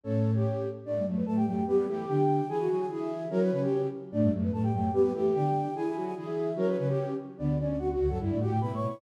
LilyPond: <<
  \new Staff \with { instrumentName = "Flute" } { \time 2/2 \key d \major \tempo 2 = 147 <cis' cis''>2. r4 | \key b \minor <d' d''>4 r8 <b b'>8 <a' a''>8 <g' g''>8 <g' g''>4 | <b b'>4 <a a'>4 <g' g''>2 | <gis' gis''>4 <gis' gis''>8 <gis' gis''>8 r8 <e' e''>4. |
<cis' cis''>2~ <cis' cis''>8 r4. | <d' d''>4 r8 <b b'>8 <a' a''>8 <g' g''>8 <g' g''>4 | <b b'>4 <a a'>4 <g' g''>2 | <gis' gis''>4 <gis' gis''>8 <gis' gis''>8 r8 <e' e''>4. |
<cis' cis''>2~ <cis' cis''>8 r4. | \key d \major <d' d''>4 <d' d''>8 <d' d''>8 <fis' fis''>8 r8 <fis' fis''>4 | r8 <d' d''>8 <fis' fis''>8 <g' g''>8 \tuplet 3/2 { <b' b''>4 <cis'' cis'''>4 <cis'' cis'''>4 } | }
  \new Staff \with { instrumentName = "Flute" } { \time 2/2 \key d \major a'4. g'2 r8 | \key b \minor a4 a4 a4 a4 | b4 g'2 r4 | gis'8 fis'4. gis'2 |
ais'8 b'8 b'8 g'4. r4 | a4 a4 a4 a4 | b4 g'2 r4 | gis'8 e'4. gis'2 |
ais'8 b'8 b'8 g'4. r4 | \key d \major b4 cis'4 fis'8 fis'4 a'8 | e'4 g'4 e'2 | }
  \new Staff \with { instrumentName = "Flute" } { \time 2/2 \key d \major <a, a>2 r2 | \key b \minor <a, a>8 <g, g>8 <fis, fis>4 <a, a>4 <fis, fis>4 | <g g'>4 <e e'>4 <d d'>2 | <e e'>4 <fis fis'>4 <e e'>2 |
<fis fis'>4 <cis cis'>2 r4 | <a, a>8 <g, g>8 <fis, fis>4 <a, a>4 <fis, fis>4 | <g g'>4 <e e'>4 <d d'>2 | <e e'>4 <fis fis'>4 <e e'>2 |
<fis fis'>4 <cis cis'>2 r4 | \key d \major <d, d>2. <d, d>8 <fis, fis>8 | \tuplet 3/2 { <g, g>4 <a, a>4 <a, a>4 } <b, b>8 <a, a>8 <b, b>8 r8 | }
>>